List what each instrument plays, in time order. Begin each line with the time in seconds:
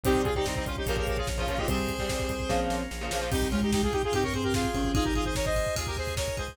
0.03 synth bass 1 C2, overdriven guitar C3 G3, drawbar organ C4 G4, marimba C4 C5, lead 2 (sawtooth) D#4 G4, kick, closed hi-hat
0.15 kick
0.24 synth bass 1 C2, lead 2 (sawtooth) F4 G#4, kick, closed hi-hat
0.35 overdriven guitar C3 G3, lead 2 (sawtooth) D#4 G4, kick
0.46 synth bass 1 C2, lead 2 (sawtooth) C4 D#4, kick, snare
0.55 lead 2 (sawtooth) C4 D#4, kick
0.66 synth bass 1 C2, lead 2 (sawtooth) C#4 F4, marimba C#4 C#5, kick, closed hi-hat
0.76 lead 2 (sawtooth) D#4 G4, kick
0.86 synth bass 1 A#1, overdriven guitar A#2 C#3 F3, drawbar organ A#3 C#4 F4, marimba C#4 C#5, lead 2 (sawtooth) G4 A#4, kick, closed hi-hat
0.97 lead 2 (sawtooth) G4 A#4, kick
1.07 synth bass 1 A#1, lead 2 (sawtooth) G4 A#4, kick, closed hi-hat
1.17 lead 2 (sawtooth) F4 G#4, kick
1.27 synth bass 1 A#1, kick, snare
1.38 overdriven guitar A#2 C#3 F3, lead 2 (sawtooth) C#4 F4, kick
1.47 synth bass 1 A#1, overdriven guitar A#2 C#3 F3, lead 2 (sawtooth) C#4 F4, kick, closed hi-hat
1.58 overdriven guitar A#2 C#3 F3, lead 2 (sawtooth) D#4 G4, kick
1.68 synth bass 1 C2, overdriven guitar C3 G3, marimba C4 C5, drawbar organ C4 G4, lead 2 (sawtooth) G#4 C5, kick, closed hi-hat
1.78 kick
1.87 synth bass 1 C2, kick, closed hi-hat
1.99 overdriven guitar C3 G3, kick
2.09 synth bass 1 C2, marimba C4 C5, kick, snare
2.19 kick
2.29 synth bass 1 C2, kick, closed hi-hat
2.40 kick
2.49 synth bass 1 A#1, overdriven guitar A#2 C#3 F3, drawbar organ A#3 C#4 F4, kick, snare
2.70 synth bass 1 A#1, snare
2.91 synth bass 1 A#1, snare
3.01 overdriven guitar A#2 C#3 F3
3.11 synth bass 1 A#1, overdriven guitar A#2 C#3 F3, snare
3.21 overdriven guitar A#2 C#3 F3
3.31 synth bass 1 C2, marimba C3 C4, drawbar organ C4 G4, lead 2 (sawtooth) D#4 G4, kick, crash
3.42 kick
3.51 marimba G#2 G#3, lead 2 (sawtooth) C#4 F4, kick, ride
3.62 lead 2 (sawtooth) D#4 G4, kick
3.72 lead 2 (sawtooth) D#4 G4, kick, snare
3.83 lead 2 (sawtooth) F4 G#4, kick
3.92 lead 2 (sawtooth) D#4 G4, kick, ride
4.03 lead 2 (sawtooth) F4 G#4, kick
4.12 synth bass 1 G2, marimba C3 C4, lead 2 (sawtooth) D#4 G4, kick, ride
4.23 lead 2 (sawtooth) A#4 C#5, kick
4.33 marimba C3 C4, lead 2 (sawtooth) G#4 C5, kick, ride
4.43 lead 2 (sawtooth) G4 A#4, kick
4.54 lead 2 (sawtooth) F4 G#4, kick, snare
4.64 kick
4.74 synth bass 1 G#1, marimba C#3 C#4, kick, ride
4.84 kick
4.94 marimba D#3 D#4, drawbar organ D#4 G#4, lead 2 (sawtooth) F4 G#4, kick, ride
5.04 lead 2 (sawtooth) G4 A#4, kick
5.15 lead 2 (sawtooth) F4 G#4, kick, ride
5.25 lead 2 (sawtooth) G#4 C5, kick
5.35 lead 2 (sawtooth) A#4 C#5, kick, snare
5.45 lead 2 (sawtooth) C5 D#5, kick
5.56 kick, ride
5.66 kick
5.75 synth bass 1 D#2, lead 2 (sawtooth) F4 G#4, kick, ride
5.87 lead 2 (sawtooth) G4 A#4, kick
5.97 lead 2 (sawtooth) G#4 C5, kick, ride
6.07 kick
6.16 lead 2 (sawtooth) A#4 C#5, kick, snare
6.28 kick
6.37 synth bass 1 C#2, lead 2 (sawtooth) G#4 C5, kick, ride
6.48 kick